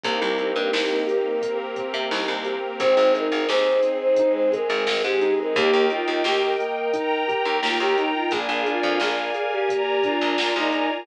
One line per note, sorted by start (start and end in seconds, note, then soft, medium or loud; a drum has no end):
0.03 0.20 C2 loud
0.03 0.35 A#3 loud
0.03 1.41 A#3 medium
0.03 1.41 C4 medium
0.03 1.41 D#4 medium
0.03 1.41 G4 medium
0.03 1.56 A#4 medium
0.03 kick medium
0.03 closed hi-hat medium
0.21 0.52 C2 loud
0.38 0.70 C4 medium
0.38 closed hi-hat medium
0.56 0.71 G2 medium
0.73 1.04 C2 loud
0.73 1.04 D#4 medium
0.73 snare loud
1.07 1.38 G4 medium
1.07 closed hi-hat medium
1.42 1.73 A#3 medium
1.42 2.79 A#3 medium
1.42 2.79 C4 medium
1.42 2.79 G4 medium
1.42 2.79 A#4 medium
1.42 kick medium
1.42 closed hi-hat medium
1.75 2.06 C4 medium
1.75 kick medium
1.75 closed hi-hat medium
1.94 2.09 C3 loud
2.11 2.27 C2 loud
2.11 2.42 D#4 medium
2.11 snare medium
2.28 2.59 C2 medium
2.45 2.76 G4 medium
2.45 closed hi-hat medium
2.80 2.95 G#1 loud
2.80 3.12 C4 loud
2.80 4.17 C4 medium
2.80 4.17 D#4 medium
2.80 4.17 G#4 medium
2.80 3.13 C5 medium
2.80 kick medium
2.80 closed hi-hat medium
2.97 3.28 G#1 medium
3.14 3.45 D#4 medium
3.14 3.46 A#4 medium
3.14 closed hi-hat medium
3.32 3.47 G#1 medium
3.48 3.80 D#2 medium
3.48 3.80 G#4 medium
3.48 3.96 C5 medium
3.48 snare medium
3.83 4.14 C4 medium
3.83 closed hi-hat medium
4.01 4.32 C5 medium
4.16 5.55 G#3 medium
4.16 5.55 C4 medium
4.16 4.50 D#4 medium
4.16 5.55 G#4 medium
4.16 kick medium
4.16 closed hi-hat medium
4.34 4.51 C5 medium
4.52 4.84 G#4 medium
4.52 5.00 A#4 medium
4.52 kick medium
4.52 closed hi-hat medium
4.70 4.85 G#1 loud
4.86 5.02 G#1 medium
4.86 5.18 C4 medium
4.86 snare loud
5.04 5.35 G#2 medium
5.04 5.34 G4 medium
5.21 5.52 D#4 medium
5.21 closed hi-hat medium
5.38 5.54 A#4 medium
5.55 5.71 D#2 loud
5.55 5.87 A#3 loud
5.55 5.85 G4 medium
5.55 6.92 A#4 medium
5.55 6.92 D#5 medium
5.55 6.92 G5 medium
5.55 kick loud
5.55 closed hi-hat medium
5.73 6.04 D#2 loud
5.90 6.22 D#4 medium
5.90 6.23 F4 medium
5.90 closed hi-hat medium
6.07 6.23 D#2 loud
6.24 6.56 D#2 loud
6.24 6.42 G4 medium
6.24 6.56 G4 medium
6.24 snare medium
6.42 7.55 A#4 medium
6.59 6.90 A#3 medium
6.59 closed hi-hat medium
6.93 7.24 D#4 medium
6.93 8.31 A#4 medium
6.93 8.31 G5 medium
6.93 8.31 A#5 medium
6.93 kick medium
6.93 closed hi-hat medium
7.28 7.59 G4 medium
7.28 kick medium
7.28 closed hi-hat medium
7.45 7.61 D#2 medium
7.62 7.78 D#2 medium
7.62 7.93 A#3 medium
7.62 7.79 F4 medium
7.62 snare loud
7.80 8.11 D#2 medium
7.80 7.96 G4 medium
7.97 8.14 D#4 medium
7.97 8.28 D#4 medium
7.97 closed hi-hat medium
8.14 8.31 F4 medium
8.31 8.47 A#1 loud
8.31 8.62 A#3 medium
8.31 8.64 G#4 medium
8.31 9.68 A#4 medium
8.31 9.68 D5 medium
8.31 9.68 F5 medium
8.31 9.68 G#5 medium
8.31 kick medium
8.31 closed hi-hat medium
8.49 8.80 A#1 loud
8.66 8.98 D4 medium
8.66 8.95 F4 medium
8.66 closed hi-hat medium
8.83 8.99 F2 loud
9.00 9.31 A#1 loud
9.00 9.32 F4 medium
9.00 9.47 G#4 medium
9.00 snare medium
9.34 9.66 G#4 medium
9.34 closed hi-hat medium
9.52 9.82 G4 medium
9.69 10.00 A#3 medium
9.69 11.06 A#4 medium
9.69 11.06 D5 medium
9.69 11.06 G#5 medium
9.69 11.06 A#5 medium
9.69 kick medium
9.69 closed hi-hat medium
9.87 10.03 G4 medium
10.03 10.35 D4 medium
10.03 10.55 F4 medium
10.03 kick medium
10.03 closed hi-hat medium
10.21 10.37 A#1 medium
10.38 10.54 A#1 medium
10.38 10.69 F4 medium
10.38 snare loud
10.56 10.87 A#1 medium
10.56 10.90 D#4 medium
10.72 11.03 G#4 medium
10.72 closed hi-hat medium
10.90 11.06 F4 medium